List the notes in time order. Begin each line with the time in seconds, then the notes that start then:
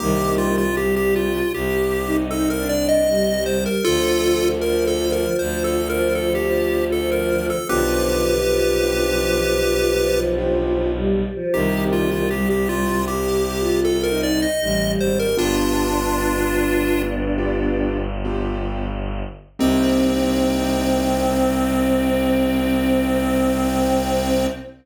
0.00 C2 D#3 G3 A#3 C4 D#4 G4
0.38 F4
0.58 F4
0.76 G3 G4
0.96 G4
1.16 F4
1.52 C2 G4
2.05 D#4
2.31 A4
2.50 A#4
2.57 D4
2.69 D5
2.89 D#5
3.08 G3
3.46 C5
3.66 A#4
3.84 D2 D3 F3 F4 A4
4.61 F3 A#4
4.87 A4
5.12 A#4
5.39 D2 F3 C5
5.64 A4
5.89 F3 A#4
6.15 A4
6.35 G4
6.42 F3
6.91 F3 A4
7.12 A#4
7.50 A4
7.69 B1 D3 F3 B3 D4 F4 G4 B4
8.46 F3
8.84 B3 D4 F4 G4
9.99 F3
10.38 B3 D4 F4 G4
10.96 G3
11.35 F3
11.54 C2 D#3 G3 A#3 C4 D#4 G4
11.93 F4
12.11 F4
12.31 G3 G4
12.50 G4
12.69 F4
13.08 G4
13.59 F4
13.85 A4
14.03 A#4
14.09 D#4
14.23 D5
14.42 D#5
14.61 A1 G3
14.99 G#1 C5
15.19 A#4
15.37 G1 B3 D4 F4 G4
17.38 B3 D4 F4 G4
18.25 B3 D4 F4 G4
19.59 C2 A#3 C4 D#4 G4